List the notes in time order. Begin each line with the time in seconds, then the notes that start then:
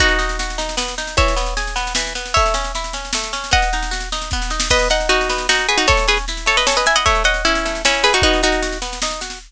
0.00 B3 D#4 F#4, kick, snare
0.08 snare
0.19 D#4, snare
0.29 snare
0.39 F#4, snare
0.50 snare
0.58 D#4, snare
0.69 snare
0.77 B3, snare
0.88 snare
0.98 D#4, snare
1.07 snare
1.17 E3 C#5 E5, kick, snare
1.28 snare
1.36 B3, snare
1.46 snare
1.57 G#4, snare
1.67 snare
1.76 B3, snare
1.87 snare
1.95 E3, snare
2.07 snare
2.15 B3, snare
2.26 snare
2.34 A3 C#5 E5, kick, snare
2.46 snare
2.54 C#4, snare
2.64 snare
2.75 E4, snare
2.84 snare
2.93 C#4, snare
3.05 snare
3.13 A3, snare
3.24 snare
3.33 C#4, snare
3.44 snare
3.51 B3 D#5 F#5, kick, snare
3.62 snare
3.73 D#4, snare
3.83 snare
3.91 F#4, snare
4.00 snare
4.12 D#4, snare
4.22 snare
4.31 B3, kick, snare
4.42 snare
4.50 D#4, snare
4.60 snare
4.70 B3 B4 D#5, kick, snare, crash
4.79 snare
4.90 D#4 D#5 F#5, snare
5.00 snare
5.09 D#4 F#4, snare
5.21 snare
5.29 B3, snare
5.38 snare
5.49 D#4 F#4, snare
5.59 snare
5.69 F#4 G#4 B4, snare
5.78 D#4 F#4, snare
5.87 A3 A4 C#5, kick, snare
5.97 snare
6.08 C#4 G#4 B4, snare
6.17 snare
6.28 E4, snare
6.37 snare
6.46 A3 A4 C#5, snare
6.57 B4 D#5, snare
6.67 C#4 A4 C#5, snare
6.77 B4 D#5, snare
6.86 E4 E5 G#5, snare
6.96 D#5 F#5, snare
7.06 A3 C#5 E5, kick, snare
7.15 snare
7.24 C#4 D#5 F#5, snare
7.34 snare
7.45 C#4 E4, snare
7.55 snare
7.65 A3, snare
7.75 snare
7.85 C#4 E4, snare
7.94 snare
8.03 E4 G#4 B4, snare
8.13 D#4 F#4, snare
8.22 B3 D#4 F#4, kick, snare
8.33 snare
8.43 D#4 F#4, snare
8.52 snare
8.63 F#4, snare
8.72 snare
8.82 B3, snare
8.93 snare
9.02 D#4, snare
9.11 snare
9.21 F#4, snare
9.30 snare